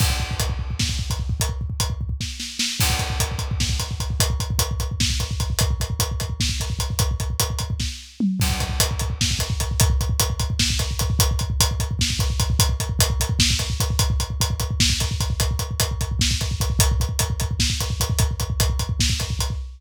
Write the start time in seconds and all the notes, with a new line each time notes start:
0.00 kick, crash
0.10 kick
0.20 kick
0.31 kick
0.40 kick, closed hi-hat
0.50 kick
0.59 kick
0.71 kick
0.79 kick, snare
0.89 kick
0.99 kick
1.10 kick, closed hi-hat
1.19 kick
1.30 kick
1.40 kick, closed hi-hat
1.49 kick
1.61 kick
1.70 kick
1.80 kick, closed hi-hat
1.90 kick
2.01 kick
2.09 kick
2.21 kick, snare
2.40 snare
2.59 snare
2.80 kick, crash
2.90 kick
2.99 kick, closed hi-hat
3.10 kick
3.20 kick, closed hi-hat
3.31 kick
3.39 kick, closed hi-hat
3.51 kick
3.60 kick, snare
3.70 kick
3.80 kick, closed hi-hat
3.91 kick
4.00 kick, closed hi-hat
4.10 kick
4.20 kick, closed hi-hat
4.30 kick
4.40 kick, closed hi-hat
4.50 kick
4.59 kick, closed hi-hat
4.71 kick
4.80 kick, closed hi-hat
4.91 kick
5.00 kick, snare
5.10 kick
5.20 kick, closed hi-hat
5.31 kick
5.40 kick, closed hi-hat
5.50 kick
5.59 kick, closed hi-hat
5.71 kick
5.80 kick, closed hi-hat
5.90 kick
6.00 kick, closed hi-hat
6.11 kick
6.20 kick, closed hi-hat
6.30 kick
6.40 kick, snare
6.49 kick
6.60 kick, closed hi-hat
6.70 kick
6.79 kick, closed hi-hat
6.90 kick
6.99 kick, closed hi-hat
7.11 kick
7.20 kick, closed hi-hat
7.30 kick
7.40 kick, closed hi-hat
7.50 kick
7.59 kick, closed hi-hat
7.70 kick
7.80 kick, snare
8.20 mid tom
8.40 kick, crash
8.49 kick
8.60 kick, closed hi-hat
8.69 kick
8.80 kick, closed hi-hat
8.91 kick
8.99 kick, closed hi-hat
9.10 kick
9.21 kick, snare
9.31 kick
9.39 kick, closed hi-hat
9.50 kick
9.60 kick, closed hi-hat
9.71 kick
9.80 kick, closed hi-hat
9.90 kick
10.01 kick, closed hi-hat
10.10 kick
10.20 kick, closed hi-hat
10.30 kick
10.40 kick, closed hi-hat
10.50 kick
10.59 kick, snare
10.70 kick
10.79 kick, closed hi-hat
10.91 kick
10.99 kick, closed hi-hat
11.10 kick
11.19 kick, closed hi-hat
11.31 kick
11.39 kick, closed hi-hat
11.50 kick
11.60 kick, closed hi-hat
11.71 kick
11.80 kick, closed hi-hat
11.91 kick
11.99 kick, snare
12.10 kick
12.19 kick, closed hi-hat
12.30 kick
12.40 kick, closed hi-hat
12.50 kick
12.59 kick, closed hi-hat
12.69 kick
12.80 kick, closed hi-hat
12.89 kick
12.99 kick, closed hi-hat
13.10 kick
13.20 kick, closed hi-hat
13.29 kick
13.39 kick, snare
13.50 kick
13.59 kick, closed hi-hat
13.70 kick
13.80 kick, closed hi-hat
13.90 kick
13.99 kick, closed hi-hat
14.10 kick
14.20 kick, closed hi-hat
14.30 kick
14.41 kick, closed hi-hat
14.50 kick
14.60 kick, closed hi-hat
14.71 kick
14.80 kick, snare
14.90 kick
15.00 kick, closed hi-hat
15.11 kick
15.20 kick, closed hi-hat
15.30 kick
15.40 kick, closed hi-hat
15.51 kick
15.59 kick, closed hi-hat
15.71 kick
15.80 kick, closed hi-hat
15.91 kick
16.01 kick, closed hi-hat
16.11 kick
16.19 kick, snare
16.31 kick
16.41 kick, closed hi-hat
16.51 kick
16.60 kick, closed hi-hat
16.70 kick
16.79 kick, closed hi-hat
16.91 kick
17.00 kick, closed hi-hat
17.09 kick
17.19 kick, closed hi-hat
17.30 kick
17.40 kick, closed hi-hat
17.51 kick
17.60 kick, snare
17.70 kick
17.80 kick, closed hi-hat
17.90 kick
18.00 kick, closed hi-hat
18.10 kick
18.19 kick, closed hi-hat
18.31 kick
18.40 kick, closed hi-hat
18.50 kick
18.60 kick, closed hi-hat
18.70 kick
18.79 kick, closed hi-hat
18.89 kick
19.00 kick, snare
19.10 kick
19.20 kick, closed hi-hat
19.30 kick
19.39 kick, closed hi-hat
19.50 kick